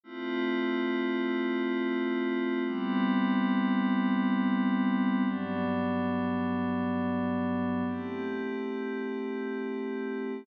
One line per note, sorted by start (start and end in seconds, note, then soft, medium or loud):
0.04 2.62 A3 medium
0.04 2.62 C4 medium
0.04 2.62 E4 medium
0.04 2.62 F4 medium
2.65 5.23 G3 medium
2.65 5.23 B3 medium
2.65 5.23 C4 medium
2.65 5.23 E4 medium
5.25 7.83 G2 medium
5.25 7.83 F#3 medium
5.25 7.83 B3 medium
5.25 7.83 D4 medium
7.86 10.44 A3 medium
7.86 10.44 C4 medium
7.86 10.44 E4 medium
7.86 10.44 G4 medium